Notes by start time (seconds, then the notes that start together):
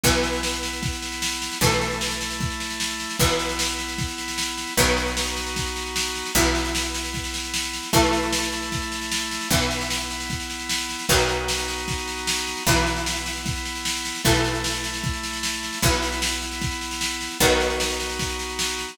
0.04 B1 E3 B3 E4, kick, snare
0.13 snare
0.23 snare
0.33 snare
0.43 snare
0.53 snare
0.63 snare
0.73 snare
0.83 kick, snare
0.93 snare
1.02 snare
1.12 snare
1.22 snare
1.32 snare
1.42 snare
1.52 snare
1.61 B1 E3 A3 E4, kick, snare
1.71 snare
1.81 snare
1.91 snare
2.01 snare
2.11 snare
2.21 snare
2.31 snare
2.40 kick, snare
2.50 snare
2.60 snare
2.70 snare
2.80 snare
2.90 snare
3.00 snare
3.10 snare
3.19 B1 E3 B3 E4, kick, snare
3.29 snare
3.39 snare
3.49 snare
3.59 snare
3.69 snare
3.79 snare
3.88 snare
3.98 kick, snare
4.08 snare
4.18 snare
4.28 snare
4.38 snare
4.48 snare
4.58 snare
4.67 snare
4.77 B1 D#3 F#3 B3 D#4 F#4, kick, snare
4.87 snare
4.97 snare
5.07 snare
5.17 snare
5.27 snare
5.37 snare
5.46 snare
5.56 kick, snare
5.66 snare
5.76 snare
5.86 snare
5.96 snare
6.06 snare
6.15 snare
6.25 snare
6.35 B1 E3 B3 E4, kick, snare
6.45 snare
6.55 snare
6.65 snare
6.75 snare
6.85 snare
6.94 snare
7.04 snare
7.14 kick, snare
7.24 snare
7.34 snare
7.44 snare
7.54 snare
7.63 snare
7.73 snare
7.83 snare
7.93 B1 E3 A3 E4, kick, snare
8.03 snare
8.13 snare
8.23 snare
8.33 snare
8.42 snare
8.52 snare
8.62 snare
8.72 kick, snare
8.82 snare
8.92 snare
9.02 snare
9.12 snare
9.21 snare
9.31 snare
9.41 snare
9.50 B1 E3 B3 E4, kick, snare
9.61 snare
9.71 snare
9.81 snare
9.90 snare
10.00 snare
10.10 snare
10.20 snare
10.30 kick, snare
10.40 snare
10.50 snare
10.60 snare
10.69 snare
10.79 snare
10.89 snare
10.99 snare
11.09 B1 D#3 F#3 B3 D#4 F#4, kick, snare
11.19 snare
11.29 snare
11.48 snare
11.58 snare
11.68 snare
11.78 snare
11.88 kick, snare
11.98 snare
12.08 snare
12.17 snare
12.27 snare
12.37 snare
12.47 snare
12.57 snare
12.67 B1 E3 B3 E4, kick, snare
12.77 snare
12.87 snare
12.96 snare
13.06 snare
13.16 snare
13.26 snare
13.36 snare
13.46 kick, snare
13.56 snare
13.65 snare
13.75 snare
13.85 snare
13.95 snare
14.05 snare
14.15 snare
14.24 B1 E3 A3 E4, kick, snare
14.35 snare
14.44 snare
14.54 snare
14.64 snare
14.74 snare
14.84 snare
14.94 snare
15.04 kick, snare
15.13 snare
15.23 snare
15.33 snare
15.43 snare
15.53 snare
15.63 snare
15.73 snare
15.82 B1 E3 B3 E4, kick, snare
15.92 snare
16.02 snare
16.12 snare
16.22 snare
16.32 snare
16.42 snare
16.52 snare
16.62 kick, snare
16.71 snare
16.81 snare
16.91 snare
17.01 snare
17.11 snare
17.21 snare
17.31 snare
17.40 B1 D#3 F#3 B3 D#4 F#4, kick, snare
17.50 snare
17.60 snare
17.70 snare
17.80 snare
17.90 snare
18.00 snare
18.10 snare
18.19 kick, snare
18.29 snare
18.39 snare
18.49 snare
18.59 snare
18.69 snare
18.79 snare
18.88 snare